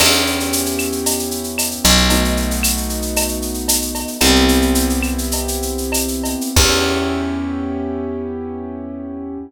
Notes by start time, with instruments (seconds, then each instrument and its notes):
0.00 electric bass (finger) E2, acoustic grand piano B3 C#4 E4 G4, crash, cowbell, claves
0.12 shaker
0.26 shaker
0.40 shaker
0.53 shaker
0.66 shaker
0.79 claves, shaker
0.92 shaker
1.06 cowbell, shaker
1.19 shaker
1.31 shaker
1.44 shaker
1.58 cowbell, claves, shaker
1.71 shaker
1.84 electric bass (finger) B1, cowbell, shaker
1.97 shaker
2.10 acoustic grand piano A3 B3 D#4 F#4, cowbell, shaker
2.25 shaker
2.37 shaker
2.51 shaker
2.63 claves, shaker
2.77 shaker
2.89 shaker
3.02 shaker
3.16 cowbell, claves, shaker
3.28 shaker
3.42 shaker
3.54 shaker
3.68 cowbell, shaker
3.82 shaker
3.95 cowbell, shaker
4.08 shaker
4.21 electric bass (finger) C2, acoustic grand piano B3 C4 E4 G4, cowbell, claves, shaker
4.35 shaker
4.48 shaker
4.62 shaker
4.75 shaker
4.90 shaker
5.03 claves, shaker
5.18 shaker
5.31 cowbell, shaker
5.48 shaker
5.62 shaker
5.78 shaker
5.92 cowbell, claves, shaker
6.08 shaker
6.24 cowbell, shaker
6.41 shaker
6.56 electric bass (finger) E2, acoustic grand piano B3 C#4 E4 G4, kick, crash